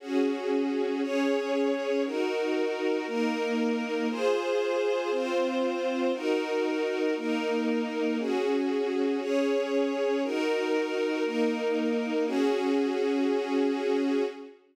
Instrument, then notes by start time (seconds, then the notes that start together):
string ensemble 1
0.00 C#4 F#4 G#4
1.02 C#4 G#4 C#5
2.04 D#4 F#4 A#4
3.07 A#3 D#4 A#4
4.10 F4 G#4 C5
5.11 C4 F4 C5
6.13 D#4 F#4 A#4
7.16 A#3 D#4 A#4
8.19 C#4 F#4 G#4
9.21 C#4 G#4 C#5
10.23 D#4 F#4 A#4
11.24 A#3 D#4 A#4
12.27 C#4 F#4 G#4